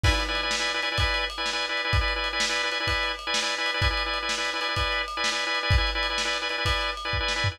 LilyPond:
<<
  \new Staff \with { instrumentName = "Drawbar Organ" } { \time 12/8 \key e \major \tempo 4. = 127 <e' b' d'' gis''>16 <e' b' d'' gis''>8 <e' b' d'' gis''>8 <e' b' d'' gis''>8 <e' b' d'' gis''>8 <e' b' d'' gis''>16 <e' b' d'' gis''>16 <e' b' d'' gis''>16 <e' b' d'' gis''>4~ <e' b' d'' gis''>16 <e' b' d'' gis''>8 <e' b' d'' gis''>8 <e' b' d'' gis''>8 <e' b' d'' gis''>16~ | <e' b' d'' gis''>16 <e' b' d'' gis''>8 <e' b' d'' gis''>8 <e' b' d'' gis''>8 <e' b' d'' gis''>8 <e' b' d'' gis''>16 <e' b' d'' gis''>16 <e' b' d'' gis''>16 <e' b' d'' gis''>4~ <e' b' d'' gis''>16 <e' b' d'' gis''>8 <e' b' d'' gis''>8 <e' b' d'' gis''>8 <e' b' d'' gis''>16 | <e' b' d'' gis''>16 <e' b' d'' gis''>8 <e' b' d'' gis''>8 <e' b' d'' gis''>8 <e' b' d'' gis''>8 <e' b' d'' gis''>16 <e' b' d'' gis''>16 <e' b' d'' gis''>16 <e' b' d'' gis''>4~ <e' b' d'' gis''>16 <e' b' d'' gis''>8 <e' b' d'' gis''>8 <e' b' d'' gis''>8 <e' b' d'' gis''>16~ | <e' b' d'' gis''>16 <e' b' d'' gis''>8 <e' b' d'' gis''>8 <e' b' d'' gis''>8 <e' b' d'' gis''>8 <e' b' d'' gis''>16 <e' b' d'' gis''>16 <e' b' d'' gis''>16 <e' b' d'' gis''>4~ <e' b' d'' gis''>16 <e' b' d'' gis''>8 <e' b' d'' gis''>8 <e' b' d'' gis''>8 <e' b' d'' gis''>16 | }
  \new DrumStaff \with { instrumentName = "Drums" } \drummode { \time 12/8 <cymc bd>8 cymr8 cymr8 sn8 cymr8 cymr8 <bd cymr>8 cymr8 cymr8 sn8 cymr8 cymr8 | <bd cymr>8 cymr8 cymr8 sn8 cymr8 cymr8 <bd cymr>8 cymr8 cymr8 sn8 cymr8 cymr8 | <bd cymr>8 cymr8 cymr8 sn8 cymr8 cymr8 <bd cymr>8 cymr8 cymr8 sn8 cymr8 cymr8 | <bd cymr>8 cymr8 cymr8 sn8 cymr8 cymr8 <bd cymr>8 cymr8 cymr8 bd8 sn8 tomfh8 | }
>>